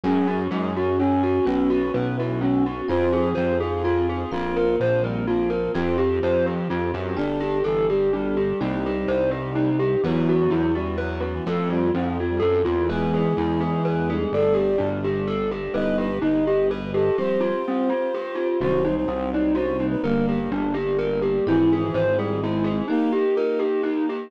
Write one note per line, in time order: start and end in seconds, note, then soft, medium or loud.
0.03 0.47 F#2 loud
0.03 1.45 C#4 medium
0.03 0.37 C#4 medium
0.03 0.27 C#4 medium
0.03 1.45 F#4 medium
0.03 0.37 F#4 medium
0.03 1.45 G#4 medium
0.03 0.37 G#4 medium
0.03 0.43 G#4 medium
0.27 0.49 F#4 medium
0.51 1.39 F#2 medium
0.51 0.73 G#3 medium
0.51 0.73 G#4 medium
0.75 0.98 C#4 medium
0.75 0.99 F#4 medium
0.98 1.45 C#4 medium
0.98 1.22 C#4 medium
1.23 1.45 F#4 medium
1.45 1.90 B1 loud
1.45 1.79 B3 loud
1.45 2.87 B3 medium
1.45 1.79 C#4 medium
1.45 2.87 C#4 medium
1.45 1.68 C#4 medium
1.45 1.79 F#4 medium
1.45 2.87 F#4 medium
1.45 1.92 B4 medium
1.70 1.92 F#4 medium
1.94 2.82 B1 medium
1.94 2.17 B3 medium
1.94 2.16 B4 medium
2.17 2.40 E4 medium
2.17 2.41 F#4 medium
2.41 2.63 C#4 medium
2.41 2.81 F#4 medium
2.66 2.88 F#4 medium
2.88 3.33 F2 loud
2.88 3.22 C4 medium
2.88 4.31 C4 medium
2.88 3.22 F4 medium
2.88 3.11 F4 medium
2.88 4.31 F4 medium
2.88 3.22 G#4 medium
2.88 4.31 G#4 medium
2.88 3.29 C5 medium
3.13 3.35 G#4 medium
3.35 4.25 F2 medium
3.35 3.58 C4 medium
3.35 3.57 C5 medium
3.60 3.84 F4 medium
3.60 3.82 G#4 medium
3.84 4.18 C4 medium
3.84 4.06 F4 medium
3.84 4.18 F4 medium
3.84 4.29 F4 medium
3.84 4.18 G#4 medium
4.09 4.31 G#4 medium
4.31 4.76 A#1 loud
4.31 5.75 A#3 medium
4.31 4.65 C4 loud
4.31 5.75 C4 medium
4.31 4.65 F4 medium
4.31 4.76 F4 medium
4.31 5.75 F4 medium
4.31 4.55 F4 loud
4.31 4.65 A#4 medium
4.56 4.78 A#4 medium
4.80 5.67 A#1 medium
4.80 5.01 F3 medium
4.80 5.03 C5 medium
5.04 5.25 G3 medium
5.04 5.26 A#4 medium
5.27 5.71 F3 medium
5.27 5.49 F4 medium
5.50 5.72 A#4 medium
5.75 6.19 F2 loud
5.75 6.08 C4 loud
5.75 5.97 C4 medium
5.75 7.18 C4 medium
5.75 5.96 F4 medium
5.75 6.08 F4 medium
5.75 7.18 F4 medium
5.75 6.08 G4 medium
5.75 7.17 G4 medium
5.98 6.20 G4 medium
6.22 6.68 F2 medium
6.22 6.54 F3 medium
6.22 6.45 C5 medium
6.46 6.68 G4 medium
6.70 6.92 F2 medium
6.70 6.92 F4 medium
6.94 7.16 F#2 medium
6.94 7.16 G4 medium
7.16 7.62 G1 loud
7.16 7.38 D4 medium
7.16 7.50 D4 medium
7.16 8.59 D4 medium
7.16 7.58 D4 medium
7.16 7.50 G4 loud
7.16 8.59 G4 medium
7.16 7.50 A4 loud
7.16 8.59 A4 medium
7.40 7.62 G4 medium
7.64 8.53 G1 medium
7.64 7.89 E3 medium
7.64 7.86 A4 loud
7.89 8.10 G3 medium
7.89 8.12 G4 medium
8.13 8.60 G3 medium
8.13 8.35 D4 medium
8.37 8.59 G4 medium
8.60 9.05 C2 medium
8.60 9.70 G3 medium
8.60 10.02 C4 medium
8.60 8.94 C4 medium
8.60 10.02 D#4 medium
8.60 8.82 D#4 loud
8.60 8.94 D#4 loud
8.60 10.02 G4 medium
8.60 8.94 G4 loud
8.86 9.08 G4 medium
9.08 9.96 C2 medium
9.08 9.30 C5 medium
9.31 9.53 G4 medium
9.55 9.77 D#4 medium
9.79 10.01 G4 medium
10.03 10.47 E2 medium
10.03 10.36 F#3 medium
10.03 11.45 B3 medium
10.03 10.38 B3 loud
10.03 11.45 E4 medium
10.03 10.38 E4 medium
10.03 11.45 F#4 medium
10.03 10.38 F#4 medium
10.03 10.27 B4 medium
10.29 10.51 F#4 medium
10.40 10.71 F#3 medium
10.50 11.39 E2 medium
10.50 10.72 E4 medium
10.75 10.98 G3 medium
10.75 10.97 F#4 medium
10.98 11.35 F#3 medium
10.98 11.20 B4 loud
11.20 11.42 F#4 medium
11.34 11.45 E3 medium
11.46 11.90 F2 loud
11.46 11.79 A3 medium
11.46 12.88 A3 medium
11.46 11.79 C4 medium
11.46 12.88 C4 medium
11.46 11.79 F4 medium
11.46 12.88 F4 medium
11.46 11.69 A4 medium
11.70 11.91 G3 medium
11.70 11.92 F4 medium
11.94 12.39 F2 medium
11.94 12.17 F3 medium
11.94 12.17 C4 loud
12.20 12.42 F4 medium
12.30 12.41 G3 medium
12.40 12.63 F#2 medium
12.40 12.62 A4 medium
12.65 13.33 E2 medium
12.65 12.87 F4 medium
12.89 14.30 G#3 medium
12.89 13.22 G#3 medium
12.89 14.30 B3 medium
12.89 13.22 B3 loud
12.89 14.30 E4 medium
12.89 13.22 E4 loud
12.89 14.10 G#4 medium
12.89 13.11 B4 medium
13.14 13.36 G#4 medium
13.37 14.25 E2 medium
13.37 13.60 E4 medium
13.60 13.82 G#4 medium
13.85 14.07 B4 medium
14.10 14.67 G3 medium
14.10 14.67 A3 medium
14.10 14.67 D4 medium
14.10 14.32 G#4 medium
14.32 14.76 G1 medium
14.32 15.73 G3 medium
14.32 15.73 A3 medium
14.32 15.73 D4 medium
14.32 14.56 A4 medium
14.32 14.90 D5 medium
14.54 14.76 G4 medium
14.78 15.68 G1 medium
14.78 15.00 D4 medium
15.04 15.26 G4 medium
15.27 15.49 A4 loud
15.51 15.73 G4 medium
15.74 16.19 G1 loud
15.74 16.08 G3 medium
15.74 16.08 B3 loud
15.74 16.08 D#4 medium
15.74 17.16 G4 medium
15.74 15.96 B4 medium
15.74 17.16 B4 medium
15.74 17.16 D#5 medium
15.74 15.98 D#5 medium
15.98 16.20 G4 medium
15.98 16.18 B4 medium
16.22 17.10 G1 medium
16.22 16.43 D#4 medium
16.22 16.45 D#5 medium
16.46 16.69 G4 medium
16.46 16.67 D#5 medium
16.70 16.90 B4 medium
16.70 16.93 B4 medium
16.94 17.16 G4 medium
16.94 17.17 A4 medium
17.18 17.52 F3 medium
17.18 17.52 G3 loud
17.18 17.52 C4 loud
17.18 18.60 F4 medium
17.18 17.40 G4 medium
17.18 18.60 G4 medium
17.18 18.60 C5 medium
17.18 18.48 C5 medium
17.40 17.62 F4 medium
17.68 17.90 C4 loud
17.90 18.12 F4 medium
18.14 18.36 G4 medium
18.35 18.57 F4 medium
18.61 19.05 C2 medium
18.61 18.94 D#3 loud
18.61 18.94 F#3 medium
18.61 20.03 F#3 medium
18.61 18.94 C4 medium
18.61 20.03 C4 medium
18.61 20.03 D#4 medium
18.61 18.83 F#4 medium
18.61 18.95 C5 medium
18.85 19.06 D#4 medium
18.97 19.30 C5 medium
19.08 19.96 C2 medium
19.08 19.30 C4 medium
19.33 19.56 D#4 medium
19.33 19.52 D5 medium
19.55 19.77 F#4 medium
19.55 19.86 C5 medium
19.80 20.02 D#4 medium
19.91 20.02 B4 medium
20.03 20.48 G1 medium
20.03 20.37 D3 medium
20.03 21.45 G3 medium
20.03 20.37 G3 medium
20.03 21.45 A#3 medium
20.03 20.37 A#3 loud
20.03 20.50 A#3 medium
20.03 21.45 D4 medium
20.03 20.25 A#4 medium
20.29 20.51 G4 medium
20.51 21.39 G1 loud
20.51 20.74 D4 medium
20.74 20.96 G4 medium
20.99 21.20 A#4 medium
21.22 21.44 G4 medium
21.46 21.90 G#1 medium
21.46 22.05 E3 medium
21.46 22.87 C4 medium
21.46 21.80 C4 medium
21.46 22.87 E4 medium
21.46 21.80 E4 loud
21.46 21.70 E4 medium
21.46 22.87 G#4 medium
21.46 21.80 G#4 medium
21.73 21.95 G#4 medium
21.94 22.82 G#1 medium
21.94 22.17 C5 medium
22.17 22.40 G3 medium
22.17 22.41 G#4 medium
22.42 22.83 G#3 medium
22.42 22.65 E4 loud
22.64 22.86 G#4 medium
22.88 23.23 A#3 medium
22.88 23.13 A#3 medium
22.88 24.31 A#3 medium
22.88 23.10 D#4 medium
22.88 23.23 D#4 medium
22.88 24.31 D#4 medium
22.88 23.23 G4 medium
22.88 24.31 G4 medium
23.12 23.34 G4 medium
23.36 23.66 D#4 medium
23.36 23.59 A#4 medium
23.59 23.81 G4 medium
23.83 24.05 D#4 medium
24.09 24.31 G4 medium